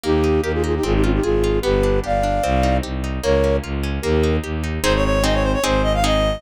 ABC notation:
X:1
M:4/4
L:1/16
Q:1/4=150
K:Fm
V:1 name="Flute"
[EG]4 [GB] [FA] [FA] [EG] [FA] [EG] [DF] [EG] [FA]4 | [G=B]4 [=df]8 z4 | [Bd]4 z4 [GB]4 z4 | [K:Ab] z16 |]
V:2 name="Clarinet"
z16 | z16 | z16 | [K:Ab] c d d2 e d c d c2 e f e4 |]
V:3 name="Orchestral Harp"
B,2 E2 G2 E2 C2 F2 A2 F2 | =B,2 =D2 G2 D2 C2 E2 G2 E2 | B,2 D2 F2 D2 B,2 E2 G2 E2 | [K:Ab] [CEA]4 [CEA]4 [CEA]4 [CEA]4 |]
V:4 name="Violin" clef=bass
E,,4 E,,4 A,,,4 A,,,4 | G,,,4 G,,,4 C,,4 C,,4 | D,,4 D,,4 E,,4 E,,4 | [K:Ab] A,,,8 A,,,8 |]